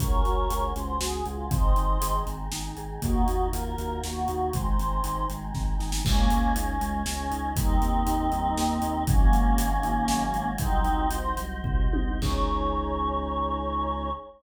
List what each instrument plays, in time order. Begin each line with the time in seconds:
0.00 synth bass 2 C#2, vibraphone C#4, choir aahs C#4 F#4 G#4 A#4 C#5, kick, closed hi-hat
0.25 synth bass 2 C#2, vibraphone F#4, closed hi-hat
0.50 synth bass 2 C#2, vibraphone G#4, closed hi-hat
0.76 synth bass 2 C#2, vibraphone C#4, choir aahs C5, closed hi-hat
1.01 synth bass 2 C#2, vibraphone F#4, choir aahs G#4, snare
1.26 synth bass 2 C#2, choir aahs F4, vibraphone G#4, closed hi-hat
1.51 synth bass 2 G#1, vibraphone C4, choir aahs C4 D#4 G#4 C5 D#5, kick, closed hi-hat
1.76 synth bass 2 G#1, vibraphone D#4, closed hi-hat
2.01 synth bass 2 G#1, vibraphone G#4, closed hi-hat
2.26 synth bass 2 G#1, vibraphone C4, closed hi-hat
2.52 synth bass 2 G#1, vibraphone D#4, snare
2.77 synth bass 2 G#1, vibraphone G#4, closed hi-hat
3.02 synth bass 2 D#2, vibraphone A#3, choir aahs A#3 D#4 F4 F#4, kick, closed hi-hat
3.28 synth bass 2 D#2, vibraphone D#4, closed hi-hat
3.53 synth bass 2 D#2, vibraphone F4, choir aahs A#4, closed hi-hat
3.78 synth bass 2 D#2, vibraphone F#4, closed hi-hat
4.03 synth bass 2 D#2, vibraphone A#3, choir aahs F#4, snare
4.28 synth bass 2 D#2, vibraphone D#4, closed hi-hat
4.53 synth bass 2 G#1, choir aahs G#3 C4 D#4 C5, vibraphone G#3, kick, closed hi-hat
4.66 choir aahs C5
4.78 synth bass 2 G#1, vibraphone C4, closed hi-hat
5.04 synth bass 2 G#1, vibraphone D#4, closed hi-hat
5.30 synth bass 2 G#1, vibraphone G#3, closed hi-hat
5.54 synth bass 2 G#1, vibraphone C4, kick, snare
5.80 synth bass 2 G#1, vibraphone D#4, snare
5.92 snare
6.05 synth bass 2 C#2, vibraphone G#3, choir aahs A#3 C#4 G#4 C#5 D#5, kick, crash
6.30 synth bass 2 C#2, vibraphone C#4, closed hi-hat
6.55 synth bass 2 C#2, choir aahs C#4, vibraphone D#4, closed hi-hat
6.81 synth bass 2 C#2, vibraphone G#3, closed hi-hat
7.06 synth bass 2 C#2, vibraphone C#4, choir aahs C#4, snare
7.31 synth bass 2 C#2, vibraphone D#4, closed hi-hat
7.56 synth bass 2 D#2, vibraphone G3, choir aahs C4 D#4 G4 A#4 D#5, kick, closed hi-hat
7.81 synth bass 2 D#2, vibraphone A#3, closed hi-hat
8.07 synth bass 2 D#2, vibraphone D#4, closed hi-hat
8.32 synth bass 2 D#2, vibraphone G3, closed hi-hat
8.57 synth bass 2 D#2, vibraphone A#3, snare
8.82 synth bass 2 D#2, vibraphone D#4, closed hi-hat
9.07 synth bass 2 G#1, vibraphone F#3, choir aahs A#3 C#4 F#4 G#4 C#5 D#5, kick, closed hi-hat
9.33 synth bass 2 G#1, vibraphone G#3, closed hi-hat
9.58 synth bass 2 G#1, vibraphone C#4, closed hi-hat
9.83 synth bass 2 G#1, vibraphone D#4, closed hi-hat
10.08 synth bass 2 G#1, vibraphone F#3, snare
10.33 synth bass 2 G#1, vibraphone G#3, closed hi-hat
10.58 synth bass 2 C2, vibraphone F#3, choir aahs C4 D#4 F#4 C5 D#5, kick, closed hi-hat
10.84 synth bass 2 C2, vibraphone C4, closed hi-hat
11.10 synth bass 2 C2, vibraphone D#4, choir aahs C5, closed hi-hat
11.37 synth bass 2 C2, vibraphone F#3, closed hi-hat
11.64 synth bass 2 C2, vibraphone C4, kick, floor tom
11.93 synth bass 2 C2, vibraphone D#4, high tom
12.22 synth bass 2 C#2, choir aahs C#4 D#4 G#4 C#5, vibraphone C#4 D#4 G#4, kick, crash